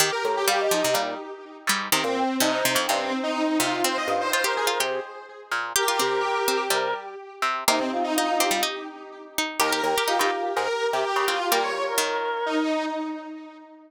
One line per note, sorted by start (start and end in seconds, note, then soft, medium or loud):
0.00 0.11 D#3 loud
0.00 0.11 G4 medium
0.12 0.23 A#4 medium
0.24 0.67 A2 medium
0.24 0.35 A#5 medium
0.37 0.48 G4 medium
0.47 0.68 G3 loud
0.47 0.72 G4 loud
0.47 0.58 F5 loud
0.60 0.94 D#5 loud
0.71 0.83 F3 loud
0.71 0.84 D#4 medium
0.84 0.96 C3 loud
0.94 1.15 A#2 medium
0.94 1.18 G3 loud
1.67 1.88 G#2 medium
1.67 1.90 G3 loud
1.92 2.04 C3 medium
1.92 2.04 D#3 loud
1.92 2.36 C4 loud
2.04 2.24 A#2 medium
2.16 2.27 G5 medium
2.40 2.63 G2 medium
2.40 2.63 C3 loud
2.40 2.64 D#4 medium
2.40 2.51 D#5 medium
2.52 2.82 C5 medium
2.65 2.77 C3 loud
2.75 2.87 F2 medium
2.75 2.87 F3 loud
2.87 3.13 G2 medium
2.87 3.12 C3 medium
2.87 3.19 C4 medium
3.23 3.57 D#4 medium
3.59 3.83 C3 loud
3.59 3.81 F4 medium
3.84 4.29 C4 loud
3.84 3.97 C5 loud
3.97 4.08 D#5 medium
4.08 4.49 G2 medium
4.08 4.19 F5 medium
4.21 4.32 C5 medium
4.31 4.45 F4 loud
4.31 4.42 C5 medium
4.31 4.54 C5 medium
4.44 4.68 G4 loud
4.44 4.79 A#4 medium
4.56 4.68 G#4 medium
4.67 4.79 F4 loud
4.80 5.00 C3 medium
4.80 5.64 G4 loud
5.51 5.73 A#2 medium
5.76 5.87 G4 loud
5.76 6.64 G4 loud
5.76 6.61 A#4 loud
5.88 6.00 F4 loud
6.00 6.40 C3 medium
6.00 6.23 C4 loud
6.48 6.69 C4 loud
6.70 6.94 C3 medium
6.70 7.15 G3 loud
6.70 6.94 A#4 loud
7.42 7.64 C3 medium
7.68 8.57 C3 medium
7.68 7.79 A#3 loud
7.68 7.79 D#4 loud
7.79 7.90 C4 medium
7.92 8.04 F4 medium
8.04 8.15 D#4 loud
8.15 8.37 D#4 medium
8.15 8.41 D#4 loud
8.15 8.27 F4 medium
8.28 8.62 F4 medium
8.39 8.52 C4 loud
8.39 8.51 G4 medium
8.51 8.62 G3 loud
8.63 8.84 D#4 loud
9.38 9.60 D#4 loud
9.60 9.82 D#2 loud
9.60 9.71 G4 loud
9.60 10.06 A#4 loud
9.72 9.84 G4 loud
9.83 9.95 D#2 medium
9.83 9.95 G4 medium
9.98 10.09 G4 loud
10.07 10.19 D#4 loud
10.07 10.19 F4 loud
10.07 10.31 G4 medium
10.19 10.31 G2 medium
10.19 11.16 D#4 loud
10.19 10.51 F4 medium
10.56 10.68 G#2 medium
10.56 10.86 A#4 medium
10.93 11.05 C3 medium
10.93 11.25 G4 medium
11.16 11.39 C#3 medium
11.27 11.39 C4 medium
11.27 11.48 F4 medium
11.51 11.92 G3 medium
11.51 11.71 A#3 loud
11.51 11.63 G4 loud
11.51 11.62 A#4 medium
11.63 11.83 C#5 medium
11.88 12.63 A#4 medium
11.98 12.44 D#3 loud
12.46 12.85 D#4 medium